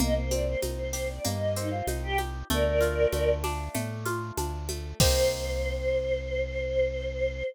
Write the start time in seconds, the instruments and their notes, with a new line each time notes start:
0.00 synth bass 1 C2, acoustic guitar (steel) A#3, choir aahs D#5, low conga, shaker
0.16 choir aahs C5
0.31 acoustic guitar (steel) C4, choir aahs D5, high conga, shaker
0.46 choir aahs C5
0.62 synth bass 1 C2, acoustic guitar (steel) D#4, high conga, shaker
0.78 choir aahs C5
0.93 acoustic guitar (steel) G4, snare, shaker
1.09 choir aahs D5
1.24 synth bass 1 G2, acoustic guitar (steel) A#3, choir aahs D#5, low conga, shaker
1.55 acoustic guitar (steel) C4, choir aahs D#4, shaker
1.71 choir aahs F4
1.87 synth bass 1 C2, acoustic guitar (steel) D#4, high conga, shaker
2.03 choir aahs G4
2.18 acoustic guitar (steel) G4, high conga, shaker
2.50 synth bass 1 D2, acoustic guitar (steel) A3, choir aahs A#4 D5, low conga, shaker
2.81 acoustic guitar (steel) F4, shaker
3.12 synth bass 1 D2, acoustic guitar (steel) A3, high conga, shaker
3.44 acoustic guitar (steel) D4, snare, high conga, shaker
3.74 synth bass 1 A2, acoustic guitar (steel) A3, low conga, shaker
4.05 acoustic guitar (steel) F4, high conga, shaker
4.37 synth bass 1 D2, acoustic guitar (steel) D4, high conga, shaker
4.69 acoustic guitar (steel) A3, high conga, shaker
5.00 synth bass 1 C2, acoustic guitar (steel) A#3 C4 D#4 G4, choir aahs C5, kick, crash